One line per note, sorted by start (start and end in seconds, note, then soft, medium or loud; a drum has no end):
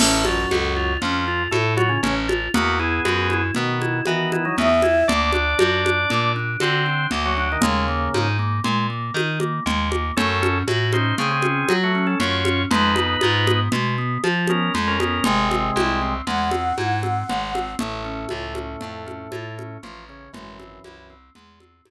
0.00 0.46 A1 medium
0.00 0.25 A2 medium
0.00 0.25 A3 medium
0.00 0.23 C#4 loud
0.00 crash loud
0.00 low conga loud
0.25 0.93 F#2 medium
0.25 0.93 F#3 medium
0.25 0.48 F4 medium
0.25 high conga medium
0.51 0.97 C#2 medium
0.51 0.74 A4 medium
0.51 high conga medium
0.76 0.99 F4 medium
1.01 1.48 F2 medium
1.01 1.43 F3 medium
1.01 1.24 C#4 medium
1.01 1.43 F4 medium
1.01 low conga medium
1.28 1.51 F4 medium
1.51 1.98 A2 medium
1.51 1.74 A3 medium
1.51 1.74 A4 medium
1.51 1.75 A4 medium
1.51 high conga medium
1.77 1.89 F#3 medium
1.77 2.00 F4 medium
1.77 1.89 F#4 medium
1.77 high conga medium
1.89 2.01 C#3 medium
1.89 2.01 C#4 medium
2.03 2.49 A1 medium
2.03 2.15 C#3 medium
2.03 2.15 C#4 medium
2.03 2.26 C#4 medium
2.03 low conga loud
2.28 2.51 F4 medium
2.28 high conga medium
2.54 3.00 E2 medium
2.54 2.78 A#3 medium
2.54 2.77 B3 medium
2.54 2.78 F#4 loud
2.54 low conga loud
2.79 3.42 B3 medium
2.79 3.02 E4 medium
2.79 3.42 G#4 medium
3.05 3.51 F#2 medium
3.05 3.28 F#4 medium
3.05 high conga loud
3.30 3.53 E4 medium
3.30 high conga medium
3.55 4.02 B2 medium
3.55 4.00 D#3 medium
3.55 4.00 B3 medium
3.55 3.79 B3 medium
3.55 low conga medium
3.81 4.04 E4 medium
3.81 high conga medium
4.06 4.31 D#3 medium
4.06 4.52 E3 medium
4.06 4.31 B3 medium
4.06 4.30 F#4 medium
4.06 high conga medium
4.32 4.45 D#3 medium
4.32 4.45 B3 medium
4.32 4.55 E4 medium
4.32 high conga medium
4.45 4.56 F#3 medium
4.45 4.56 D#4 medium
4.57 5.04 E2 medium
4.57 4.69 F#3 medium
4.57 4.81 B3 loud
4.57 4.69 D#4 medium
4.57 5.08 E5 medium
4.57 low conga medium
4.82 5.06 E4 medium
4.82 high conga medium
5.08 5.55 D2 medium
5.08 5.31 A#3 loud
5.08 6.32 D4 medium
5.08 6.32 D5 medium
5.08 low conga loud
5.33 5.57 D4 medium
5.33 high conga medium
5.59 6.06 F#2 medium
5.59 5.82 F#4 medium
5.59 high conga loud
5.85 6.08 D4 medium
5.85 high conga medium
6.10 6.57 A#2 medium
6.10 6.33 A#3 medium
6.10 low conga medium
6.36 6.59 D4 medium
6.60 7.07 D3 medium
6.60 7.07 C4 medium
6.60 6.84 F#4 medium
6.60 7.07 C5 medium
6.60 high conga medium
6.86 7.09 D4 medium
7.11 7.57 D2 medium
7.11 7.35 A#3 medium
7.11 low conga medium
7.26 7.48 F#3 medium
7.26 7.48 F#4 medium
7.37 7.60 D4 medium
7.52 7.64 D#3 medium
7.52 7.64 D#4 medium
7.61 8.09 D#2 medium
7.61 8.28 C#3 medium
7.61 7.86 G#3 loud
7.61 8.28 A#3 medium
7.61 low conga loud
7.88 8.11 A#3 medium
8.14 8.60 G#2 medium
8.14 8.37 D#4 medium
8.14 high conga medium
8.39 8.62 A#3 medium
8.64 9.11 A#2 medium
8.64 8.87 G#3 loud
8.64 low conga medium
8.90 9.13 A#3 medium
9.14 9.60 D#3 medium
9.14 9.38 D#4 medium
9.14 high conga medium
9.40 9.64 A#3 medium
9.40 high conga medium
9.66 10.12 D#2 medium
9.66 9.89 G#3 medium
9.66 low conga loud
9.91 10.14 A#3 medium
9.91 high conga medium
10.17 10.63 F#2 medium
10.17 10.40 A3 loud
10.17 10.58 C#4 medium
10.17 10.58 A4 loud
10.17 low conga loud
10.42 10.65 C#4 medium
10.42 high conga medium
10.68 11.13 A2 medium
10.68 10.91 F#4 medium
10.68 high conga medium
10.93 11.15 C#4 medium
10.93 11.15 D#4 medium
10.93 11.15 C5 medium
10.93 high conga medium
11.18 11.64 C#3 medium
11.18 11.41 A3 loud
11.18 11.31 C4 medium
11.18 11.31 G#4 medium
11.18 low conga medium
11.31 11.74 C4 medium
11.31 11.74 G#4 medium
11.42 11.67 C#4 medium
11.42 high conga medium
11.69 12.15 F#3 medium
11.69 11.92 F#4 medium
11.69 high conga loud
11.83 12.06 A3 medium
11.83 12.06 F#4 medium
11.95 12.18 C#4 medium
12.07 12.19 C#4 medium
12.07 12.19 A4 medium
12.20 12.65 F#2 medium
12.20 12.43 A3 medium
12.20 12.63 F4 medium
12.20 12.63 C#5 medium
12.20 low conga loud
12.45 12.69 C#4 medium
12.45 high conga medium
12.71 13.16 F2 medium
12.71 12.94 G#3 loud
12.71 13.60 D#4 medium
12.71 13.60 B4 medium
12.71 low conga loud
12.96 13.20 B3 medium
12.96 high conga medium
13.21 13.69 G#2 medium
13.21 13.45 F4 medium
13.21 high conga loud
13.47 13.70 B3 medium
13.47 high conga loud
13.72 14.18 B2 medium
13.72 13.96 G#3 medium
13.72 low conga loud
13.98 14.21 B3 medium
14.24 14.70 F3 medium
14.24 14.47 F4 medium
14.24 high conga medium
14.47 14.72 B3 medium
14.47 14.73 C#4 medium
14.47 14.73 A#4 medium
14.47 high conga medium
14.74 15.20 F2 medium
14.74 14.97 G#3 loud
14.74 low conga medium
14.88 14.99 C#4 medium
14.88 14.99 A#4 medium
15.00 15.23 B3 medium
15.00 15.24 C#4 medium
15.00 15.24 A#4 medium
15.00 high conga medium
15.24 15.71 G#1 medium
15.24 16.14 C3 medium
15.24 15.48 G#3 loud
15.24 16.14 G#3 loud
15.24 low conga loud
15.51 15.73 C4 medium
15.51 high conga medium
15.76 16.22 C2 medium
15.76 15.99 E4 medium
15.76 high conga loud
16.02 16.25 C4 medium
16.27 16.73 E2 medium
16.27 16.50 G#3 loud
16.27 17.72 F#5 medium
16.27 low conga medium
16.51 16.75 C4 medium
16.51 high conga medium
16.78 17.24 G#2 medium
16.78 17.00 E4 medium
16.78 high conga medium
17.03 17.26 C4 medium
17.03 high conga medium
17.29 17.75 G#1 medium
17.29 17.52 G#3 medium
17.29 low conga loud
17.54 17.77 C4 medium
17.54 high conga medium
17.79 18.26 A1 medium
17.79 19.77 A2 medium
17.79 18.03 A3 loud
17.79 19.77 A3 medium
17.79 low conga loud
18.05 18.28 C#4 medium
18.29 18.76 C#2 medium
18.29 18.53 F4 medium
18.29 high conga loud
18.55 18.79 C#4 medium
18.55 high conga loud
18.81 19.28 F2 medium
18.81 19.05 A3 medium
18.81 low conga loud
19.06 19.29 C#4 medium
19.06 high conga medium
19.32 19.78 A2 medium
19.32 19.55 F4 medium
19.32 high conga loud
19.58 19.81 C#4 medium
19.58 high conga medium
19.83 20.29 A1 medium
19.83 20.04 F3 medium
19.83 20.06 A3 medium
19.83 20.04 F4 medium
19.83 low conga medium
20.09 20.31 C#3 medium
20.09 20.32 C#4 medium
20.09 20.31 C#4 medium
20.33 20.79 G#1 medium
20.33 21.14 F#2 medium
20.33 21.14 E3 medium
20.33 20.57 G#3 loud
20.33 low conga loud
20.59 20.82 C4 medium
20.59 high conga medium
20.84 21.30 C2 medium
20.84 21.08 E4 medium
20.84 high conga medium
21.10 21.33 C4 medium
21.35 21.81 E2 medium
21.35 21.59 G#3 medium
21.35 low conga medium
21.60 21.84 C4 medium
21.60 high conga medium
21.85 21.90 G#2 medium
21.85 21.90 E4 loud
21.85 high conga loud